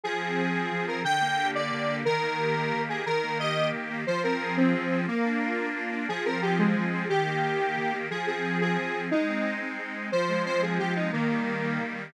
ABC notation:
X:1
M:6/8
L:1/8
Q:3/8=119
K:Fdor
V:1 name="Lead 1 (square)"
A5 B | g3 d3 | B5 A | B2 e2 z2 |
c B2 C3 | B,4 z2 | A B G A,3 | G6 |
A A2 A3 | E3 z3 | c2 c A G E | B,5 z |]
V:2 name="Accordion"
F, C A C F, C | D, B, G B, D, B, | E, B, G B, E, B, | E, B, G B, E, B, |
F, C A C F, C | B, D F D B, D | F, C A C F, C | E, B, G B, E, B, |
F, C A C F, C | A, C E C A, C | F, A, C A, F, A, | E, G, B, G, E, G, |]